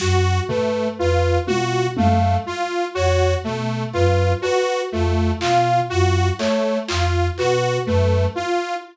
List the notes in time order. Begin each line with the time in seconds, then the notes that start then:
0.00 F#2 F#4, snare
0.48 A3 B4, floor tom
0.98 F2 F4 B4
1.47 B2 F4 F#4, high tom
1.97 F#2 A3 F5, high tom
2.46 F4
2.95 F2 F#4 C#5
3.44 B2 A3
3.93 F#2 F4 B4, clap
4.42 F#4 B4, cowbell
4.92 F2 A3 F4
5.41 B2 F4 F5, clap
5.90 F#2 F4 F#4
6.39 A3 C#5, clap
6.88 F2 F4, clap
7.38 B2 F#4 B4, clap
7.86 F#2 A3 B4
8.35 F4